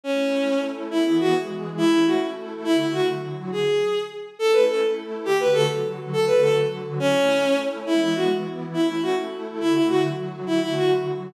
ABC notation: X:1
M:6/8
L:1/8
Q:3/8=138
K:Amix
V:1 name="Violin"
C4 z2 | [K:Emix] E E F z3 | E E F z3 | E E F z3 |
G4 z2 | [K:Amix] A B A z3 | G B A z3 | A B A z3 |
C4 z2 | [K:Emix] E E F z3 | E E F z3 | E E F z3 |
E E F z3 |]
V:2 name="Pad 2 (warm)"
[A,CE]3 [A,EA]3 | [K:Emix] [E,B,G]3 [E,G,G]3 | [A,CE]3 [A,EA]3 | [D,A,F]3 [D,F,F]3 |
z6 | [K:Amix] [A,CE]3 [A,EA]3 | [D,A,F]3 [D,F,F]3 | [D,A,F]3 [D,F,F]3 |
[A,CE]3 [A,EA]3 | [K:Emix] [E,G,B,]3 [E,B,E]3 | [A,CE]3 [A,EA]3 | [D,A,F]3 [D,F,F]3 |
[D,A,F]3 [D,F,F]3 |]